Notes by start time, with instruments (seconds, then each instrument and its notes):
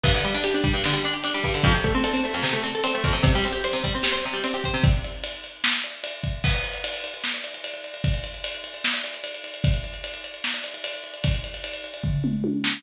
0.04 acoustic guitar (steel) G2, kick, crash
0.15 acoustic guitar (steel) D3
0.24 acoustic guitar (steel) G3, ride
0.34 acoustic guitar (steel) D4
0.44 acoustic guitar (steel) G4, ride
0.54 acoustic guitar (steel) D4
0.64 acoustic guitar (steel) G3, kick, ride
0.74 acoustic guitar (steel) G2
0.84 acoustic guitar (steel) D3, snare
0.93 acoustic guitar (steel) G3
1.04 acoustic guitar (steel) D4, ride
1.14 acoustic guitar (steel) G4
1.24 acoustic guitar (steel) D4, ride
1.34 acoustic guitar (steel) G3
1.44 acoustic guitar (steel) G2, kick, ride
1.54 acoustic guitar (steel) D3
1.64 acoustic guitar (steel) F2, kick, ride
1.75 acoustic guitar (steel) C3
1.84 acoustic guitar (steel) A3, kick, ride
1.95 acoustic guitar (steel) C4
2.04 acoustic guitar (steel) A4, ride
2.14 acoustic guitar (steel) C4
2.24 acoustic guitar (steel) A3, ride
2.34 acoustic guitar (steel) F2
2.43 acoustic guitar (steel) C3, snare
2.53 acoustic guitar (steel) A3
2.64 acoustic guitar (steel) C4, ride
2.75 acoustic guitar (steel) A4
2.84 acoustic guitar (steel) C4, ride
2.95 acoustic guitar (steel) A3
3.04 acoustic guitar (steel) F2, kick, ride
3.13 acoustic guitar (steel) C3
3.23 acoustic guitar (steel) C3, kick, ride
3.35 acoustic guitar (steel) G3
3.44 acoustic guitar (steel) C4, ride
3.53 acoustic guitar (steel) G4
3.64 acoustic guitar (steel) C5, ride
3.73 acoustic guitar (steel) C3
3.84 acoustic guitar (steel) G3, kick, ride
3.95 acoustic guitar (steel) C4
4.03 acoustic guitar (steel) G4, snare
4.12 acoustic guitar (steel) C5
4.24 acoustic guitar (steel) C3, ride
4.33 acoustic guitar (steel) G3
4.44 acoustic guitar (steel) C4, ride
4.54 acoustic guitar (steel) G4
4.64 acoustic guitar (steel) C5, kick, ride
4.74 acoustic guitar (steel) C3
4.84 kick, ride
5.04 ride
5.24 ride
5.44 ride
5.64 snare
5.84 ride
6.04 ride
6.24 kick, ride
6.44 kick, crash
6.54 ride
6.64 ride
6.73 ride
6.84 ride
6.94 ride
7.04 ride
7.14 ride
7.24 snare
7.34 ride
7.44 ride
7.54 ride
7.64 ride
7.74 ride
7.84 ride
7.94 ride
8.04 kick, ride
8.14 ride
8.24 ride
8.34 ride
8.44 ride
8.54 ride
8.64 ride
8.74 ride
8.84 snare
8.94 ride
9.04 ride
9.14 ride
9.24 ride
9.34 ride
9.44 ride
9.54 ride
9.64 kick, ride
9.74 ride
9.84 ride
9.94 ride
10.04 ride
10.14 ride
10.24 ride
10.34 ride
10.44 snare
10.54 ride
10.64 ride
10.74 ride
10.84 ride
10.93 ride
11.04 ride
11.14 ride
11.24 kick, ride
11.34 ride
11.44 ride
11.54 ride
11.64 ride
11.73 ride
11.84 ride
11.94 ride
12.04 kick, floor tom
12.24 mid tom
12.44 high tom
12.64 snare